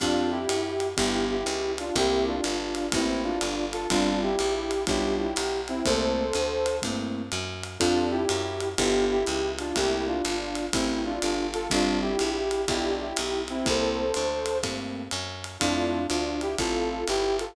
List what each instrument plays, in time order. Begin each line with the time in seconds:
0.00 electric bass (finger) F2, acoustic grand piano C4 F4 G4 A4, brass section D4 F4, kick, ride
0.31 brass section E4 G4
0.49 electric bass (finger) F#2, hi-hat pedal, ride
0.80 ride
0.97 electric bass (finger) G1, acoustic grand piano B3 D4 F4 G4, brass section E4 G4, kick, ride
1.30 brass section E4 G4
1.46 electric bass (finger) C#2, hi-hat pedal, ride
1.78 brass section D4 F4, ride
1.95 electric bass (finger) C2, acoustic grand piano A3 A#3 C4 E4, brass section E4 G4, kick, ride
2.27 brass section D4 F4
2.44 electric bass (finger) G1, hi-hat pedal, ride
2.75 ride
2.92 electric bass (finger) A1, acoustic grand piano A3 A#3 C4 E4, brass section C4 E4, kick, ride
3.23 brass section D4 F4
3.41 electric bass (finger) G1, hi-hat pedal, ride
3.73 brass section F4 A4, ride
3.90 electric bass (finger) G1, acoustic grand piano G3 C4 D4 F4, brass section D4 F4, kick, ride
4.22 brass section E4 G4
4.39 electric bass (finger) A#1, hi-hat pedal, ride
4.71 ride
4.87 electric bass (finger) B1, acoustic grand piano G3 B3 D4 F4, brass section E4 G4, kick, ride
5.19 brass section E4 G4
5.36 electric bass (finger) B1, hi-hat pedal, ride
5.68 brass section C4 E4, ride
5.85 electric bass (finger) C2, acoustic grand piano A3 A#3 C4 E4, brass section A4 C5, kick, ride
6.33 electric bass (finger) D2, hi-hat pedal, ride
6.66 ride
6.82 electric bass (finger) G2, acoustic grand piano A3 A#3 C4 E4, kick, ride
7.32 electric bass (finger) F#2, hi-hat pedal, ride
7.64 ride
7.79 electric bass (finger) F2, acoustic grand piano C4 F4 G4 A4, brass section D4 F4, kick, ride
8.11 brass section E4 G4
8.29 electric bass (finger) F#2, hi-hat pedal, ride
8.60 ride
8.77 electric bass (finger) G1, acoustic grand piano B3 D4 F4 G4, brass section E4 G4, kick, ride
9.11 brass section E4 G4
9.26 electric bass (finger) C#2, hi-hat pedal, ride
9.59 brass section D4 F4, ride
9.75 electric bass (finger) C2, acoustic grand piano A3 A#3 C4 E4, brass section E4 G4, kick, ride
10.07 brass section D4 F4
10.25 electric bass (finger) G1, hi-hat pedal, ride
10.55 ride
10.73 electric bass (finger) A1, acoustic grand piano A3 A#3 C4 E4, brass section C4 E4, kick, ride
11.05 brass section D4 F4
11.22 electric bass (finger) G1, hi-hat pedal, ride
11.53 brass section F4 A4, ride
11.70 electric bass (finger) G1, acoustic grand piano G3 C4 D4 F4, brass section D4 F4, kick, ride
12.01 brass section E4 G4
12.19 electric bass (finger) A#1, hi-hat pedal, ride
12.51 ride
12.68 electric bass (finger) B1, acoustic grand piano G3 B3 D4 F4, brass section E4 G4, kick, ride
13.00 brass section E4 G4
13.16 electric bass (finger) B1, hi-hat pedal, ride
13.48 brass section C4 E4, ride
13.66 electric bass (finger) C2, acoustic grand piano A3 A#3 C4 E4, brass section A4 C5, kick, ride
14.14 electric bass (finger) D2, hi-hat pedal, ride
14.46 ride
14.63 electric bass (finger) G2, acoustic grand piano A3 A#3 C4 E4, kick, ride
15.11 electric bass (finger) F#2, hi-hat pedal, ride
15.44 ride
15.60 electric bass (finger) F2, acoustic grand piano A3 C4 E4 F4, brass section D4 F4, kick, ride
16.09 electric bass (finger) D2, brass section D4 F4, hi-hat pedal, ride
16.41 brass section E4 G4, ride
16.58 electric bass (finger) A1, acoustic grand piano A3 C4 E4 F4, brass section F4 A4, kick, ride
17.07 electric bass (finger) G1, brass section E4 G4, hi-hat pedal, ride
17.39 brass section F4 A4, ride